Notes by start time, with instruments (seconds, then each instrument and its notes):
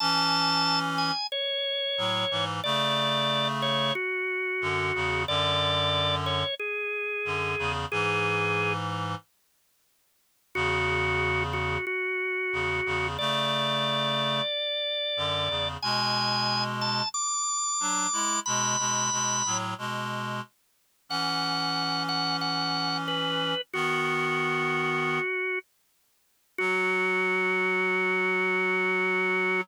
0.00 clarinet E3 C#4, drawbar organ A5
0.98 drawbar organ G#5
1.32 drawbar organ C#5
1.98 clarinet A2 F#3
2.31 clarinet G#2 E3
2.64 clarinet C#3 A3, drawbar organ D5
3.62 drawbar organ C#5
3.95 drawbar organ F#4
4.61 clarinet F#2 D3
4.95 clarinet E2 C#3
5.28 clarinet F#2 D3, drawbar organ D5
6.26 drawbar organ C#5
6.59 drawbar organ G#4
7.25 clarinet F#2 D3
7.59 clarinet E2 C#3
7.91 clarinet G#2 E3, drawbar organ G#4
10.55 clarinet E2 C#3, drawbar organ F#4
11.53 drawbar organ F#4
11.87 drawbar organ F#4
12.53 clarinet E2 C#3
12.86 clarinet E2 C#3
13.19 clarinet C#3 A3, drawbar organ D5
15.17 clarinet F#2 D3
15.49 clarinet E2 C#3
15.82 clarinet B2 G#3, drawbar organ G#5
16.81 drawbar organ A5
17.14 drawbar organ D6
17.80 clarinet F#3 D4
18.13 clarinet G#3 E4
18.46 clarinet B2 G#3, drawbar organ B5
18.79 clarinet B2 G#3
19.12 clarinet B2 G#3
19.46 clarinet A2 F#3
19.78 clarinet B2 G#3
21.09 clarinet E3 C#4, drawbar organ F#5
22.09 drawbar organ F#5
22.41 drawbar organ F#5
23.08 drawbar organ B4
23.73 clarinet D#3 B3, drawbar organ F#4
26.58 clarinet F#3, drawbar organ F#4